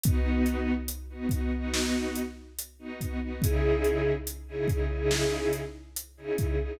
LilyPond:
<<
  \new Staff \with { instrumentName = "String Ensemble 1" } { \time 4/4 \key cis \minor \tempo 4 = 71 <b dis' fis'>4~ <b dis' fis'>16 <b dis' fis'>16 <b dis' fis'>16 <b dis' fis'>4. <b dis' fis'>16 <b dis' fis'>16 <b dis' fis'>16 | <cis dis' e' gis'>4~ <cis dis' e' gis'>16 <cis dis' e' gis'>16 <cis dis' e' gis'>16 <cis dis' e' gis'>4. <cis dis' e' gis'>16 <cis dis' e' gis'>16 <cis dis' e' gis'>16 | }
  \new DrumStaff \with { instrumentName = "Drums" } \drummode { \time 4/4 <hh bd>8 hh8 hh8 <hh bd>8 sn8 hh8 hh8 <hh bd>8 | <hh bd>8 hh8 hh8 <hh bd>8 sn8 hh8 hh8 <hh bd>8 | }
>>